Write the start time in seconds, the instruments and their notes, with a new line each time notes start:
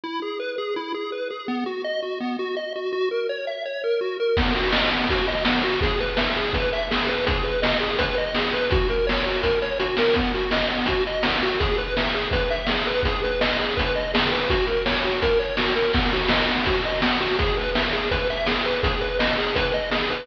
0.04 lead 1 (square) E4
0.22 lead 1 (square) G#4
0.39 lead 1 (square) B4
0.58 lead 1 (square) G#4
0.76 lead 1 (square) E4
0.94 lead 1 (square) G#4
1.12 lead 1 (square) B4
1.30 lead 1 (square) G#4
1.48 lead 1 (square) B3
1.66 lead 1 (square) F#4
1.84 lead 1 (square) D#5
2.02 lead 1 (square) F#4
2.20 lead 1 (square) B3
2.39 lead 1 (square) F#4
2.56 lead 1 (square) D#5
2.75 lead 1 (square) F#4
2.92 lead 1 (square) F#4
3.11 lead 1 (square) A#4
3.29 lead 1 (square) C#5
3.47 lead 1 (square) E5
3.65 lead 1 (square) C#5
3.84 lead 1 (square) A#4
4.01 lead 1 (square) F#4
4.20 lead 1 (square) A#4
4.37 lead 1 (square) B3, kick, crash
4.55 lead 1 (square) F#4, closed hi-hat
4.73 lead 1 (square) D#5, snare
4.90 lead 1 (square) B3, closed hi-hat
5.09 lead 1 (square) F#4, kick, closed hi-hat
5.27 lead 1 (square) D#5, closed hi-hat
5.45 lead 1 (square) B3, snare
5.63 lead 1 (square) F#4, closed hi-hat
5.81 lead 1 (square) G#4, kick, closed hi-hat
6.00 lead 1 (square) B4, closed hi-hat
6.17 lead 1 (square) E5, snare
6.36 lead 1 (square) G#4, closed hi-hat
6.53 lead 1 (square) B4, kick, closed hi-hat
6.72 lead 1 (square) E5, closed hi-hat
6.90 lead 1 (square) G#4, snare
7.07 lead 1 (square) B4, closed hi-hat
7.27 lead 1 (square) G#4, kick, closed hi-hat
7.44 lead 1 (square) B4, closed hi-hat
7.62 lead 1 (square) D#5, snare
7.80 lead 1 (square) G#4, closed hi-hat
7.99 lead 1 (square) B4, kick, closed hi-hat
8.18 lead 1 (square) D#5, closed hi-hat
8.34 lead 1 (square) G#4, snare
8.53 lead 1 (square) B4, closed hi-hat
8.71 lead 1 (square) F#4, kick, closed hi-hat
8.88 lead 1 (square) A#4, closed hi-hat
9.07 lead 1 (square) C#5, snare
9.25 lead 1 (square) F#4, closed hi-hat
9.43 lead 1 (square) A#4, kick, closed hi-hat
9.62 lead 1 (square) C#5, closed hi-hat
9.80 lead 1 (square) F#4, closed hi-hat
9.97 lead 1 (square) A#4, snare
10.14 lead 1 (square) B3, kick, closed hi-hat
10.34 lead 1 (square) F#4, closed hi-hat
10.51 lead 1 (square) D#5, snare
10.70 lead 1 (square) B3, closed hi-hat
10.86 lead 1 (square) F#4, kick, closed hi-hat
11.07 lead 1 (square) D#5, closed hi-hat
11.23 lead 1 (square) B3, snare
11.42 lead 1 (square) F#4, closed hi-hat
11.60 lead 1 (square) G#4, kick, closed hi-hat
11.77 lead 1 (square) B4, closed hi-hat
11.97 lead 1 (square) E5, snare
12.14 lead 1 (square) G#4, closed hi-hat
12.31 lead 1 (square) B4, kick, closed hi-hat
12.50 lead 1 (square) E5, closed hi-hat
12.67 lead 1 (square) G#4, snare
12.87 lead 1 (square) B4
13.03 lead 1 (square) G#4, kick, closed hi-hat
13.23 lead 1 (square) B4, closed hi-hat
13.41 lead 1 (square) D#5, snare
13.59 lead 1 (square) G#4, closed hi-hat
13.77 lead 1 (square) B4, kick, closed hi-hat
13.95 lead 1 (square) D#5, closed hi-hat
14.13 lead 1 (square) G#4, snare
14.32 lead 1 (square) B4, closed hi-hat
14.50 lead 1 (square) F#4, kick, closed hi-hat
14.67 lead 1 (square) A#4, closed hi-hat
14.85 lead 1 (square) C#5, snare
15.02 lead 1 (square) F#4, closed hi-hat
15.22 lead 1 (square) A#4, kick, closed hi-hat
15.39 lead 1 (square) C#5, closed hi-hat
15.57 lead 1 (square) F#4, snare
15.75 lead 1 (square) A#4, closed hi-hat
15.93 lead 1 (square) B3, kick, crash
16.12 lead 1 (square) F#4, closed hi-hat
16.29 lead 1 (square) D#5, snare
16.48 lead 1 (square) B3, closed hi-hat
16.66 lead 1 (square) F#4, kick, closed hi-hat
16.83 lead 1 (square) D#5, closed hi-hat
17.02 lead 1 (square) B3, snare
17.20 lead 1 (square) F#4, closed hi-hat
17.39 lead 1 (square) G#4, kick, closed hi-hat
17.57 lead 1 (square) B4, closed hi-hat
17.75 lead 1 (square) E5, snare
17.92 lead 1 (square) G#4, closed hi-hat
18.11 lead 1 (square) B4, kick, closed hi-hat
18.30 lead 1 (square) E5, closed hi-hat
18.46 lead 1 (square) G#4, snare
18.65 lead 1 (square) B4, closed hi-hat
18.83 lead 1 (square) G#4, kick, closed hi-hat
19.01 lead 1 (square) B4, closed hi-hat
19.19 lead 1 (square) D#5, snare
19.38 lead 1 (square) G#4, closed hi-hat
19.55 lead 1 (square) B4, kick, closed hi-hat
19.72 lead 1 (square) D#5, closed hi-hat
19.91 lead 1 (square) G#4, snare
20.10 lead 1 (square) B4, closed hi-hat